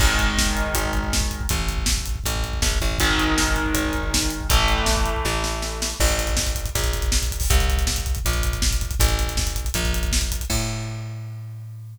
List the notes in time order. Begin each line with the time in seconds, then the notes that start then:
0.00 G#1 D#3 G#3, kick, crash
0.10 kick
0.19 kick, closed hi-hat
0.27 kick
0.38 kick, snare
0.46 kick
0.56 kick, closed hi-hat
0.66 kick
0.74 G#1, kick, closed hi-hat
0.85 kick
0.93 kick, closed hi-hat
1.04 kick
1.13 kick, snare
1.21 kick
1.31 kick, closed hi-hat
1.41 kick
1.49 A1, kick, closed hi-hat
1.58 kick
1.69 kick, closed hi-hat
1.78 kick
1.86 kick, snare
1.98 kick
2.06 kick, closed hi-hat
2.16 kick
2.24 A1, kick, closed hi-hat
2.36 kick
2.44 kick, closed hi-hat
2.53 kick
2.62 A#1, kick, snare
2.72 kick
2.81 A1, kick, closed hi-hat
2.91 kick
2.99 G#1 D#3 G#3, kick, closed hi-hat
3.10 kick
3.18 kick, closed hi-hat
3.27 kick
3.38 kick, snare
3.48 kick
3.56 kick, closed hi-hat
3.66 kick
3.74 G#1, kick, closed hi-hat
3.85 kick
3.93 kick, closed hi-hat
4.03 kick
4.14 kick, snare
4.22 kick
4.30 closed hi-hat
4.41 kick
4.50 A1 E3 A3, kick, closed hi-hat
4.59 kick
4.68 kick, closed hi-hat
4.78 kick
4.86 kick, snare
4.97 kick
5.05 kick, closed hi-hat
5.16 kick
5.25 A1, kick, snare
5.44 snare
5.62 snare
5.82 snare
6.00 A1, kick, crash
6.09 kick, closed hi-hat
6.19 kick, closed hi-hat
6.27 kick, closed hi-hat
6.37 kick, snare
6.46 kick, closed hi-hat
6.55 kick, closed hi-hat
6.66 kick, closed hi-hat
6.75 A#1, kick, closed hi-hat
6.83 kick, closed hi-hat
6.93 kick, closed hi-hat
7.02 kick, closed hi-hat
7.12 kick, snare
7.22 kick, closed hi-hat
7.31 kick, closed hi-hat
7.40 kick, open hi-hat
7.50 C2, kick, closed hi-hat
7.59 kick, closed hi-hat
7.69 kick, closed hi-hat
7.78 kick, closed hi-hat
7.87 kick, snare
7.96 kick, closed hi-hat
8.06 kick, closed hi-hat
8.15 kick, closed hi-hat
8.25 A#1, kick, closed hi-hat
8.33 kick, closed hi-hat
8.43 kick, closed hi-hat
8.53 kick, closed hi-hat
8.62 kick, snare
8.71 kick, closed hi-hat
8.81 kick, closed hi-hat
8.91 kick, closed hi-hat
9.00 A1, kick, closed hi-hat
9.09 kick, closed hi-hat
9.19 kick, closed hi-hat
9.27 kick, closed hi-hat
9.37 kick, snare
9.47 kick, closed hi-hat
9.56 kick, closed hi-hat
9.64 kick, closed hi-hat
9.74 A#1, kick, closed hi-hat
9.84 kick, closed hi-hat
9.93 kick, closed hi-hat
10.03 kick, closed hi-hat
10.12 kick, snare
10.21 kick, closed hi-hat
10.32 kick, closed hi-hat
10.40 kick, closed hi-hat
10.50 A2, kick, crash